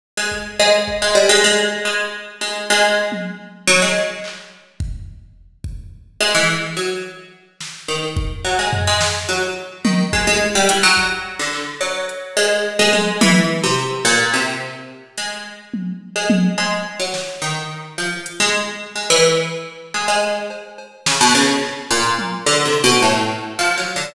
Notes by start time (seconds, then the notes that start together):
0.17 G#3
0.32 kick
0.59 G#3
0.88 kick
1.02 G#3
1.15 G3
1.29 G#3
1.44 G#3
1.85 G#3
2.41 G#3
2.70 G#3
3.12 high tom
3.67 F#3
3.82 G#3
4.24 clap
4.80 kick
5.64 kick
6.21 G#3
6.35 E3
6.77 F#3
7.61 snare
7.88 D#3
8.17 kick
8.45 F#3
8.59 G#3
8.73 floor tom
8.87 G#3
9.01 snare
9.29 F#3
9.85 D#3, high tom
10.13 G#3, kick
10.27 G#3
10.55 G3
10.69 E3, closed hi-hat
10.83 F#3
10.97 kick
11.39 D3
11.53 clap
11.81 F#3
12.09 closed hi-hat
12.37 G#3
12.79 G#3
12.93 G#3, high tom
13.21 E3, high tom
13.64 C3
14.05 A#2
14.33 C3, closed hi-hat
15.18 G#3, closed hi-hat
15.74 high tom
16.16 G#3
16.30 high tom
16.58 G#3, cowbell
17.00 F#3
17.14 snare
17.42 D#3
17.98 F3
18.26 closed hi-hat
18.40 G#3
18.96 G#3
19.10 E3
19.94 G#3
20.08 G#3
20.50 cowbell
20.78 cowbell
21.06 C#3, snare
21.21 B2
21.35 C#3
21.62 clap
21.91 A#2
22.18 high tom
22.46 D3
22.65 C3
22.84 B2
23.02 A2
23.59 F3
23.78 F#3
23.96 D3